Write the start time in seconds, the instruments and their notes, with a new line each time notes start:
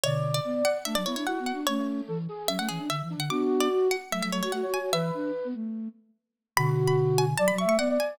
0.03 flute B2 D3 D5, harpsichord C#5
0.34 harpsichord D5
0.44 flute B3
0.65 harpsichord F#5
0.85 flute A3 D4, harpsichord E5
0.95 flute F#3, harpsichord D5
1.05 flute B3 E4, harpsichord C#5
1.16 flute D4, harpsichord C#5
1.26 flute E4 F#4, harpsichord F#5
1.35 flute B3 F#4
1.46 harpsichord F#5
1.53 flute D4
1.67 flute A3 C#4, harpsichord C#5
1.79 flute A3
2.08 flute E3 A4
2.29 flute G#4
2.47 flute F#3 C#4, harpsichord E5
2.58 flute A3, harpsichord F#5
2.69 flute E3, harpsichord G#4
2.79 flute D4
2.89 flute D3, harpsichord E5
3.02 flute E3
3.10 flute D4
3.17 flute D3, harpsichord F#5
3.30 flute B3 D4 F#4, harpsichord D6
3.60 harpsichord D5
3.72 flute F#4
3.91 harpsichord F#5
4.11 flute F#3 A3, harpsichord E5
4.22 flute F#3, harpsichord E5
4.31 flute F#3 A3, harpsichord C#5
4.43 flute F#4, harpsichord C#5
4.52 flute A3 F#4, harpsichord F#5
4.62 flute F#4 C#5
4.74 harpsichord G#5
4.80 flute F#4
4.92 flute E3 B4, harpsichord E5
5.14 flute D4
5.44 flute B3
5.54 flute A3
6.57 flute B2 D3 F#4, harpsichord B5
6.87 harpsichord B5
7.18 harpsichord G#5
7.37 flute F#3 D5, harpsichord A5
7.48 harpsichord B5
7.52 flute F#3
7.58 flute E5, harpsichord C#6
7.65 flute A3, harpsichord C#6
7.78 flute B3 D5, harpsichord F#5
7.89 flute D5
8.00 harpsichord G#5